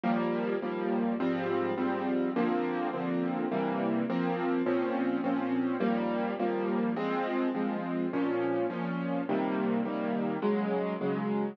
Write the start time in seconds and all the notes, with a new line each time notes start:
0.04 D#2 F3 G3 A#3
0.62 D#2 F3 G3 A#3
1.20 G#2 F3 G3 C4
1.78 G#2 F3 G3 C4
2.36 D3 F3 A#3 C4
2.93 D3 F3 A#3 C4
3.52 C3 E3 G3 A#3
4.10 F3 A#3 C4
4.66 A#2 F3 C4 C#4
5.24 A#2 F3 C4 C#4
5.80 D#2 F3 G3 A#3
6.40 D#2 F3 G3 A#3
6.96 F3 G#3 C4
7.55 F3 G#3 C4
8.13 A#2 F3 C#4
8.70 A#2 F3 C#4
9.29 C3 D#3 G3 A#3
9.85 C3 D#3 G3 A#3
10.42 C#3 F#3 G#3
11.01 C#3 F#3 G#3